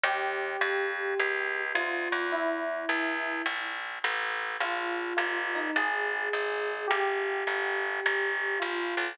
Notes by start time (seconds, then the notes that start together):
0.03 D#2 G4
0.61 F2
1.19 C#2
1.75 D2 F4
2.12 E2
2.32 E4
2.89 C#2
3.46 A#1
4.04 A1
4.60 A#1 F4
5.17 G1 F4
5.55 D#4
5.76 G#1 G#4
6.33 G#1
6.88 G1 G4
7.47 G1
8.06 G1
8.60 A#1 F4
8.97 B1